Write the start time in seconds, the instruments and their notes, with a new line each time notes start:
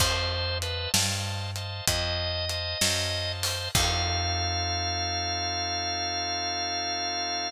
0.00 electric bass (finger) F2, drawbar organ C5 D#5 F5 A5, kick, crash
0.62 drawbar organ B4 C5 D#5 F5 A5, closed hi-hat
0.94 electric bass (finger) G2, drawbar organ C5 D#5 F5 A5, snare
1.56 drawbar organ C5 D#5 F5 A5, closed hi-hat
1.88 electric bass (finger) F2, drawbar organ C5 D#5 F5 A5, kick, closed hi-hat
2.49 drawbar organ C5 D#5 F5 A5, closed hi-hat
2.81 electric bass (finger) F#2, drawbar organ C5 D#5 F5 A5, snare
3.43 drawbar organ C5, open hi-hat
3.75 electric bass (finger) F2, drawbar organ C4 D#4 F4 A4 F5, kick, crash